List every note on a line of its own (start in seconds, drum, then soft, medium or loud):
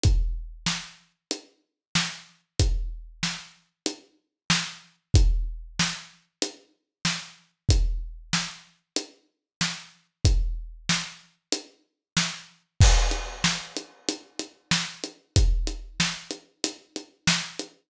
0.03 kick medium
0.03 closed hi-hat medium
0.66 snare medium
1.31 closed hi-hat medium
1.95 snare medium
2.60 kick medium
2.60 closed hi-hat medium
3.23 snare medium
3.86 closed hi-hat medium
4.50 snare loud
5.14 kick loud
5.14 closed hi-hat medium
5.79 snare medium
6.42 closed hi-hat medium
7.05 snare medium
7.69 kick medium
7.69 closed hi-hat medium
8.33 snare medium
8.96 closed hi-hat medium
9.61 snare medium
10.25 kick medium
10.25 closed hi-hat medium
10.89 snare medium
11.52 closed hi-hat medium
12.17 snare medium
12.80 kick loud
12.80 crash loud
13.11 closed hi-hat medium
13.44 snare medium
13.77 closed hi-hat medium
14.09 closed hi-hat medium
14.39 closed hi-hat medium
14.71 snare medium
15.04 closed hi-hat medium
15.36 kick medium
15.36 closed hi-hat loud
15.67 closed hi-hat medium
16.00 snare medium
16.31 closed hi-hat medium
16.64 closed hi-hat loud
16.96 closed hi-hat medium
17.27 snare loud
17.59 closed hi-hat medium